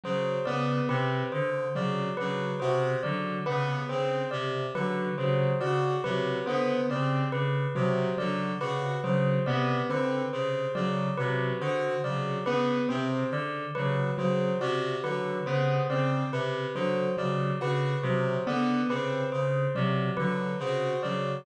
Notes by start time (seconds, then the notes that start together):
0.04 C#3 F#3 C5
0.46 C#3 B3 D5
0.89 C3 C4 B4
1.32 D3 C5
1.75 C#3 F#3 D5
2.17 C#3 F#3 B4
2.60 C3 F#4 C5
3.03 D3 F#3 D5
3.46 C#3 B3 B4
3.89 C#3 C4 C5
4.31 C3 D5
4.75 D3 F#3 B4
5.18 C#3 F#3 C5
5.61 C#3 F#4 D5
6.04 C3 F#3 B4
6.46 D3 B3 C5
6.89 C#3 C4 D5
7.32 C#3 B4
7.75 C3 F#3 C5
8.17 D3 F#3 D5
8.61 C#3 F#4 B4
9.04 C#3 F#3 C5
9.46 C3 B3 D5
9.89 D3 C4 B4
10.33 C#3 C5
10.75 C#3 F#3 D5
11.18 C3 F#3 B4
11.60 D3 F#4 C5
12.04 C#3 F#3 D5
12.45 C#3 B3 B4
12.89 C3 C4 C5
13.31 D3 D5
13.75 C#3 F#3 B4
14.18 C#3 F#3 C5
14.61 C3 F#4 D5
15.04 D3 F#3 B4
15.46 C#3 B3 C5
15.89 C#3 C4 D5
16.32 C3 B4
16.75 D3 F#3 C5
17.17 C#3 F#3 D5
17.61 C#3 F#4 B4
18.03 C3 F#3 C5
18.47 D3 B3 D5
18.89 C#3 C4 B4
19.32 C#3 C5
19.75 C3 F#3 D5
20.17 D3 F#3 B4
20.59 C#3 F#4 C5
21.03 C#3 F#3 D5